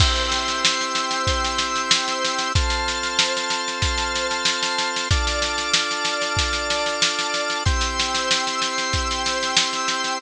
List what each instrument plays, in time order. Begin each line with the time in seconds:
0.00 drawbar organ C4 E4 G4 C5 G5 E6, kick, snare, crash
0.16 snare
0.32 snare
0.48 snare
0.65 snare
0.81 snare
0.95 snare
1.11 snare
1.27 kick, snare
1.44 snare
1.58 snare
1.76 snare
1.91 snare
2.08 snare
2.24 snare
2.39 snare
2.55 drawbar organ C4 F4 A4 C5 A5 F6, kick, snare
2.70 snare
2.88 snare
3.03 snare
3.19 snare
3.37 snare
3.50 snare
3.68 snare
3.82 kick, snare
3.98 snare
4.16 snare
4.31 snare
4.45 snare
4.63 snare
4.78 snare
4.96 snare
5.10 drawbar organ D4 F4 A4 D5 A5 F6, kick, snare
5.27 snare
5.42 snare
5.58 snare
5.74 snare
5.91 snare
6.05 snare
6.22 snare
6.37 kick, snare
6.53 snare
6.70 snare
6.86 snare
7.02 snare
7.19 snare
7.34 snare
7.50 snare
7.65 drawbar organ C4 E4 G4 C5 G5 E6, kick, snare
7.81 snare
7.99 snare
8.15 snare
8.31 snare
8.47 snare
8.62 snare
8.78 snare
8.93 kick, snare
9.11 snare
9.26 snare
9.43 snare
9.57 snare
9.73 snare
9.88 snare
10.04 snare